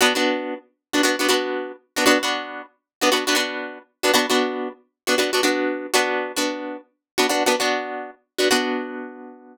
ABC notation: X:1
M:4/4
L:1/16
Q:"Swing 16ths" 1/4=116
K:Bm
V:1 name="Acoustic Guitar (steel)"
[B,DF] [B,DF]6 [B,DF] [B,DF] [B,DF] [B,DF]5 [B,DF] | [B,DF] [B,DF]6 [B,DF] [B,DF] [B,DF] [B,DF]5 [B,DF] | [B,DF] [B,DF]6 [B,DF] [B,DF] [B,DF] [B,DF]4 [B,DF]2- | "^rit." [B,DF] [B,DF]6 [B,DF] [B,DF] [B,DF] [B,DF]5 [B,DF] |
[B,DF]16 |]